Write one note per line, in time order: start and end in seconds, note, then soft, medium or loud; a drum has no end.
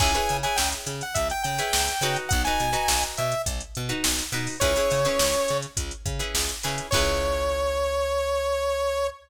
0.00 0.18 C#2 loud
0.00 0.11 E4 medium
0.00 0.11 G#4 medium
0.00 0.11 B4 loud
0.00 0.11 C#5 loud
0.00 0.37 G#5 medium
0.00 kick loud
0.00 crash loud
0.14 0.37 E4 medium
0.14 0.37 G#4 medium
0.14 0.37 B4 medium
0.14 0.37 C#5 medium
0.14 closed hi-hat medium
0.29 0.46 C#3 medium
0.29 closed hi-hat medium
0.43 0.90 E4 medium
0.43 0.90 G#4 medium
0.43 0.90 B4 medium
0.43 0.90 C#5 medium
0.43 0.57 G#5 medium
0.43 closed hi-hat medium
0.56 0.74 C#2 medium
0.56 0.70 G5 medium
0.56 snare loud
0.72 closed hi-hat medium
0.86 1.02 C#3 medium
0.86 closed hi-hat medium
1.01 1.16 F#5 medium
1.01 closed hi-hat medium
1.14 1.32 C#2 medium
1.14 1.28 E5 medium
1.14 kick medium
1.14 closed hi-hat loud
1.30 1.43 G5 medium
1.30 closed hi-hat medium
1.43 1.61 C#3 medium
1.43 2.17 G5 medium
1.43 closed hi-hat medium
1.58 1.93 E4 medium
1.58 1.93 G#4 medium
1.58 1.93 B4 medium
1.58 1.93 C#5 medium
1.58 closed hi-hat medium
1.73 1.90 C#2 medium
1.73 snare loud
1.88 snare medium
1.88 closed hi-hat medium
2.01 2.17 C#3 medium
2.01 2.43 D#4 loud
2.01 2.43 F#4 loud
2.01 2.43 B4 loud
2.01 snare soft
2.01 closed hi-hat medium
2.16 closed hi-hat medium
2.29 2.48 B1 loud
2.29 2.42 F#5 loud
2.29 kick loud
2.29 closed hi-hat loud
2.45 2.70 D#4 medium
2.45 2.70 F#4 medium
2.45 2.70 B4 medium
2.45 3.03 G#5 medium
2.45 closed hi-hat medium
2.60 2.76 B2 medium
2.60 closed hi-hat medium
2.73 3.19 D#4 loud
2.73 3.19 F#4 medium
2.73 3.19 B4 medium
2.73 closed hi-hat medium
2.88 3.04 B1 medium
2.88 snare loud
3.03 closed hi-hat medium
3.17 3.34 B2 medium
3.17 3.42 E5 medium
3.17 closed hi-hat medium
3.32 closed hi-hat medium
3.46 3.62 B1 medium
3.46 kick medium
3.46 closed hi-hat loud
3.60 closed hi-hat medium
3.75 3.93 B2 medium
3.75 closed hi-hat medium
3.89 4.24 D#4 medium
3.89 4.24 F#4 medium
3.89 4.24 B4 medium
3.89 closed hi-hat medium
4.04 4.21 B1 medium
4.04 snare loud
4.18 snare medium
4.18 closed hi-hat medium
4.32 4.48 B2 medium
4.32 4.56 D#4 medium
4.32 4.56 F#4 medium
4.32 4.56 B4 medium
4.32 closed hi-hat medium
4.47 open hi-hat medium
4.60 4.77 C#2 medium
4.60 4.72 C#4 loud
4.60 4.72 E4 loud
4.60 4.72 G#4 loud
4.60 4.72 B4 loud
4.60 5.58 C#5 loud
4.60 kick loud
4.60 closed hi-hat loud
4.76 5.00 C#4 medium
4.76 5.00 E4 medium
4.76 5.00 G#4 medium
4.76 5.00 B4 medium
4.76 snare soft
4.76 closed hi-hat medium
4.91 5.07 C#3 medium
4.91 closed hi-hat medium
5.05 5.51 C#4 medium
5.05 5.51 E4 medium
5.05 5.51 G#4 medium
5.05 5.51 B4 medium
5.05 closed hi-hat medium
5.19 5.36 C#2 medium
5.19 snare loud
5.34 closed hi-hat medium
5.48 5.66 C#3 medium
5.48 closed hi-hat medium
5.62 closed hi-hat medium
5.77 5.93 C#2 medium
5.77 kick medium
5.77 closed hi-hat loud
5.91 closed hi-hat medium
6.06 6.21 C#3 medium
6.06 kick loud
6.06 closed hi-hat medium
6.19 6.54 C#4 medium
6.19 6.54 E4 medium
6.19 6.54 G#4 medium
6.19 6.54 B4 medium
6.19 closed hi-hat medium
6.34 6.50 C#2 medium
6.34 snare loud
6.49 closed hi-hat medium
6.63 6.81 C#3 medium
6.63 6.87 C#4 medium
6.63 6.87 E4 medium
6.63 6.87 G#4 medium
6.63 6.87 B4 medium
6.63 snare medium
6.63 closed hi-hat medium
6.78 closed hi-hat medium
6.91 9.10 C#2 loud
6.91 9.10 G#4 loud
6.91 9.10 B4 loud
6.91 9.07 C#5 loud
6.91 9.10 C#5 medium
6.91 kick loud
6.91 crash loud
6.95 9.10 E4 loud